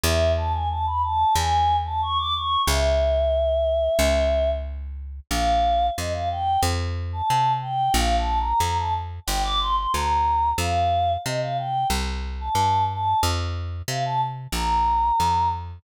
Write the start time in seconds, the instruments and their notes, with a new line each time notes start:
0.04 electric bass (finger) E2, choir aahs E5
0.37 choir aahs A5
0.53 choir aahs G#5
0.70 choir aahs A5
0.86 choir aahs B5
1.02 choir aahs A5
1.35 electric bass (finger) E2, choir aahs G#5
1.85 choir aahs A5
2.02 choir aahs C#6
2.18 choir aahs D6
2.34 choir aahs C#6
2.67 electric bass (finger) C#2, choir aahs E5
3.99 electric bass (finger) C#2
5.31 electric bass (finger) A#1, choir aahs F5
5.97 electric bass (finger) F2, choir aahs D#5
6.13 choir aahs F5
6.30 choir aahs G5
6.63 electric bass (finger) F2
7.13 choir aahs A5
7.30 electric bass (finger) C3
7.62 choir aahs G5
7.94 electric bass (finger) A#1, choir aahs F5
8.18 choir aahs A5
8.39 choir aahs A#5
8.60 electric bass (finger) F2, choir aahs A#5
8.78 choir aahs A5
9.27 electric bass (finger) G1, choir aahs G5
9.43 choir aahs D6
9.60 choir aahs C6
9.76 choir aahs C6
9.93 electric bass (finger) D2, choir aahs A#5
10.58 electric bass (finger) F2, choir aahs F5
11.25 electric bass (finger) C3, choir aahs D#5
11.41 choir aahs F5
11.58 choir aahs G5
11.90 electric bass (finger) C2
12.40 choir aahs A5
12.55 electric bass (finger) G2
12.90 choir aahs A5
13.23 electric bass (finger) F2
13.88 electric bass (finger) C3, choir aahs F5
14.05 choir aahs A5
14.52 electric bass (finger) A#1, choir aahs A#5
15.20 electric bass (finger) F2